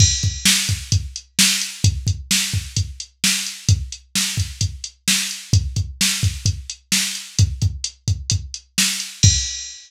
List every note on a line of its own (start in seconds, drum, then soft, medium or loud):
0.00 kick medium
0.00 crash loud
0.23 kick medium
0.23 closed hi-hat medium
0.45 snare loud
0.69 kick medium
0.69 closed hi-hat medium
0.92 kick medium
0.92 closed hi-hat medium
1.16 closed hi-hat medium
1.39 snare loud
1.62 closed hi-hat medium
1.84 kick loud
1.84 closed hi-hat loud
2.07 kick medium
2.07 closed hi-hat medium
2.31 snare medium
2.54 kick medium
2.76 kick medium
2.76 closed hi-hat medium
3.00 closed hi-hat medium
3.24 snare medium
3.47 closed hi-hat medium
3.69 kick medium
3.69 closed hi-hat medium
3.92 closed hi-hat medium
4.15 snare medium
4.37 kick medium
4.37 closed hi-hat medium
4.61 kick medium
4.61 closed hi-hat medium
4.84 closed hi-hat medium
5.08 snare medium
5.31 closed hi-hat medium
5.53 kick loud
5.53 closed hi-hat loud
5.76 kick medium
5.76 closed hi-hat medium
6.01 snare medium
6.23 kick medium
6.23 closed hi-hat medium
6.46 kick medium
6.46 closed hi-hat medium
6.70 closed hi-hat medium
6.92 snare medium
7.15 closed hi-hat medium
7.39 kick medium
7.39 closed hi-hat medium
7.62 kick medium
7.62 closed hi-hat medium
7.84 closed hi-hat medium
8.08 kick medium
8.08 closed hi-hat medium
8.30 kick medium
8.30 closed hi-hat medium
8.54 closed hi-hat medium
8.78 snare medium
9.00 closed hi-hat medium
9.23 kick loud
9.23 crash loud